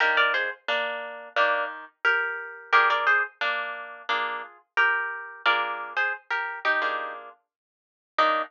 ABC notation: X:1
M:4/4
L:1/16
Q:1/4=88
K:Eb
V:1 name="Acoustic Guitar (steel)"
[GB] [Bd] [Ac] z [B,D]4 [B,D]2 z2 [GB]4 | [GB] [Bd] [Ac] z [B,D]4 [B,D]2 z2 [GB]4 | [Bd]3 [Ac] z [GB]2 [EG]3 z6 | E4 z12 |]
V:2 name="Acoustic Guitar (steel)"
[E,B,D]8 [E,G]8 | [B,DFA]8 [FA]8 | [B,DFA]8 [B,DFA]8 | [E,B,DG]4 z12 |]